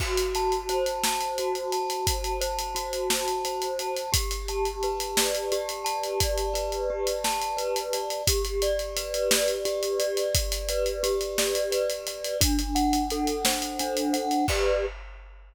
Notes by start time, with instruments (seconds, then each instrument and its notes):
0.00 glockenspiel F#4, kick, crash
0.18 closed hi-hat
0.35 glockenspiel A5, closed hi-hat
0.52 closed hi-hat
0.69 glockenspiel C5, closed hi-hat
0.86 closed hi-hat
1.04 glockenspiel A5, snare
1.21 closed hi-hat
1.38 glockenspiel F#4, closed hi-hat
1.55 closed hi-hat
1.72 glockenspiel A5, closed hi-hat
1.90 closed hi-hat
2.07 glockenspiel A5, kick, closed hi-hat
2.24 closed hi-hat
2.41 glockenspiel C5, closed hi-hat
2.59 closed hi-hat
2.75 glockenspiel F#4, closed hi-hat
2.93 closed hi-hat
3.10 glockenspiel A5, snare
3.28 closed hi-hat
3.45 glockenspiel C5, closed hi-hat
3.62 closed hi-hat
3.79 glockenspiel A5, closed hi-hat
3.97 closed hi-hat
4.12 glockenspiel G4, kick, closed hi-hat
4.31 closed hi-hat
4.48 glockenspiel A5, closed hi-hat
4.65 closed hi-hat
4.83 glockenspiel B4, closed hi-hat
5.00 closed hi-hat
5.17 glockenspiel D5, snare
5.35 closed hi-hat
5.52 glockenspiel G4, closed hi-hat
5.69 closed hi-hat
5.84 glockenspiel A5, closed hi-hat
6.04 closed hi-hat
6.20 glockenspiel D5, kick, closed hi-hat
6.38 closed hi-hat
6.54 glockenspiel B4, closed hi-hat
6.72 closed hi-hat
6.90 glockenspiel G4
7.07 closed hi-hat
7.24 glockenspiel A5, snare
7.42 closed hi-hat
7.57 glockenspiel B4, closed hi-hat
7.76 closed hi-hat
7.93 glockenspiel D5, closed hi-hat
8.10 closed hi-hat
8.27 glockenspiel G4, kick, closed hi-hat
8.45 closed hi-hat
8.62 glockenspiel D5, closed hi-hat
8.79 closed hi-hat
8.97 glockenspiel B4, closed hi-hat
9.14 closed hi-hat
9.31 glockenspiel D5, snare
9.48 closed hi-hat
9.65 glockenspiel G4, closed hi-hat
9.83 closed hi-hat
9.99 glockenspiel D5, closed hi-hat
10.17 closed hi-hat
10.35 glockenspiel D5, kick, closed hi-hat
10.52 closed hi-hat
10.69 glockenspiel B4, closed hi-hat
10.86 closed hi-hat
11.03 glockenspiel G4, closed hi-hat
11.21 closed hi-hat
11.38 glockenspiel D5, snare
11.55 closed hi-hat
11.71 glockenspiel B4, closed hi-hat
11.90 closed hi-hat
12.07 glockenspiel D5, closed hi-hat
12.24 closed hi-hat
12.41 glockenspiel D4, kick, closed hi-hat
12.59 closed hi-hat
12.75 glockenspiel F#5, closed hi-hat
12.93 closed hi-hat
13.10 glockenspiel A4, closed hi-hat
13.27 closed hi-hat
13.45 glockenspiel C5, snare
13.62 closed hi-hat
13.79 glockenspiel D4, closed hi-hat
13.97 closed hi-hat
14.13 glockenspiel F#5, closed hi-hat
14.31 closed hi-hat
14.48 glockenspiel G4 B4 D5, kick, crash